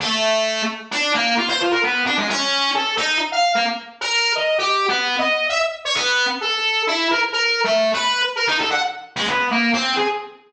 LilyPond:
\new Staff { \time 2/4 \tempo 4 = 131 a4. r8 | d'8 bes8 f'16 c''16 f'16 bes'16 | b8 d'16 aes16 des'4 | a'8 ees'8 r16 f''8 bes16 |
r8. bes'8. ees''8 | \tuplet 3/2 { g'4 b4 ees''4 } | e''16 r8 des''16 b8. r16 | a'4 e'8 bes'16 r16 |
\tuplet 3/2 { bes'4 a4 b'4 } | r16 bes'16 ees'16 a'16 ges''16 r8. | aes16 b8 bes8 c'8 aes'16 | }